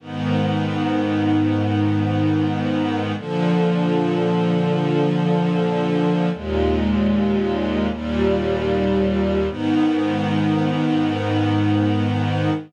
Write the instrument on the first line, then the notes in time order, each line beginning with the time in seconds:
string ensemble 1
0.00 G#2 D#3 B3
3.16 A#2 D3 F3
6.32 D#2 A#2 G#3
7.89 D#2 A#2 G3
9.47 G#2 D#3 B3